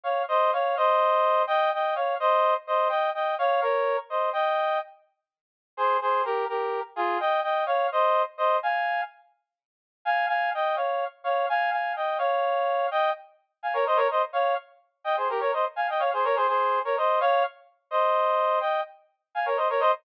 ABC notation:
X:1
M:6/8
L:1/16
Q:3/8=84
K:Ebmix
V:1 name="Brass Section"
[df]2 [ce]2 [df]2 [ce]6 | [eg]2 [eg]2 [df]2 [ce]3 z [ce]2 | [eg]2 [eg]2 [df]2 [Bd]3 z [ce]2 | [eg]4 z8 |
[Ac]2 [Ac]2 [GB]2 [GB]3 z [FA]2 | [eg]2 [eg]2 [df]2 [ce]3 z [ce]2 | [fa]4 z8 | [fa]2 [fa]2 [eg]2 [df]3 z [df]2 |
[fa]2 [fa]2 [eg]2 [df]6 | [eg]2 z4 [fa] [Bd] [ce] [Bd] [ce] z | [df]2 z4 [eg] [Ac] [GB] [Bd] [ce] z | [fa] [eg] [df] [Ac] [Bd] [Ac] [Ac]3 [Bd] [ce]2 |
[df]2 z4 [ce]6 | [eg]2 z4 [fa] [Bd] [ce] [Bd] [ce] z |]